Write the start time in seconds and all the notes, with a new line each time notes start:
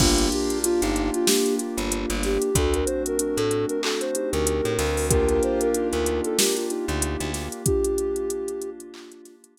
0.00 G1 A#3 D4 F4 G4, kick, crash
0.18 closed hi-hat
0.32 G4, closed hi-hat
0.50 closed hi-hat
0.64 D4 F4, closed hi-hat
0.82 G1 D#4, snare, closed hi-hat
0.96 closed hi-hat
1.14 F4, closed hi-hat
1.27 A#3 D4 G4, snare
1.46 closed hi-hat
1.59 D4 F4, closed hi-hat
1.78 G1, closed hi-hat
1.92 closed hi-hat
2.10 G1, closed hi-hat
2.23 G4, snare, closed hi-hat
2.42 closed hi-hat
2.55 D2 A3 C4 D4 F#4 A4, kick, closed hi-hat
2.74 A#4, closed hi-hat
2.86 C5, closed hi-hat
3.06 A#4, closed hi-hat
3.19 D4 F#4, closed hi-hat
3.37 A2 A4, closed hi-hat
3.51 closed hi-hat
3.68 A#4, closed hi-hat
3.83 D4 F#4 A4, clap
4.01 C5, closed hi-hat
4.15 D#4 G4, closed hi-hat
4.32 D2 A#4, closed hi-hat
4.47 closed hi-hat
4.65 A2, closed hi-hat
4.79 D2, snare, closed hi-hat
4.97 open hi-hat
5.10 A#3 D4 F4 G4 A#4, kick, closed hi-hat
5.29 A#4, closed hi-hat
5.43 C5, closed hi-hat
5.61 A#4, closed hi-hat
5.74 D#4 G4, closed hi-hat
5.92 D2 A#4, closed hi-hat
6.06 closed hi-hat
6.24 A4, closed hi-hat
6.38 G4 A#4, snare
6.55 F4, closed hi-hat
6.70 D#4 G4, closed hi-hat
6.88 D2, closed hi-hat
7.02 closed hi-hat
7.20 D2, closed hi-hat
7.34 snare, closed hi-hat
7.52 closed hi-hat
7.66 A#3 D4 F4 G4, kick, closed hi-hat
7.84 closed hi-hat
7.98 closed hi-hat
8.16 closed hi-hat
8.30 closed hi-hat
8.48 closed hi-hat
8.62 closed hi-hat
8.80 closed hi-hat
8.94 clap
9.12 closed hi-hat
9.25 snare, closed hi-hat
9.44 closed hi-hat
9.57 closed hi-hat